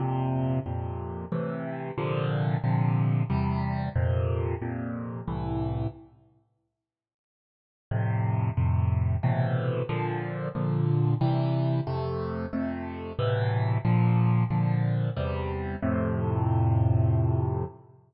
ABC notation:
X:1
M:3/4
L:1/8
Q:1/4=91
K:F
V:1 name="Acoustic Grand Piano"
[F,,B,,C,]2 [F,,B,,C,]2 [A,,C,E,]2 | [B,,C,D,F,]2 [B,,C,D,F,]2 [E,,C,G,]2 | [F,,B,,C,]2 [F,,B,,C,]2 [C,,A,,E,]2 | z6 |
[F,,A,,C,]2 [F,,A,,C,]2 [A,,=B,,C,E,]2 | [B,,D,F,]2 [B,,D,F,]2 [C,E,G,]2 | [F,,C,A,]2 [F,,C,A,]2 [A,,=B,,C,E,]2 | [B,,D,F,]2 [B,,D,F,]2 [E,,C,G,]2 |
[F,,A,,C,]6 |]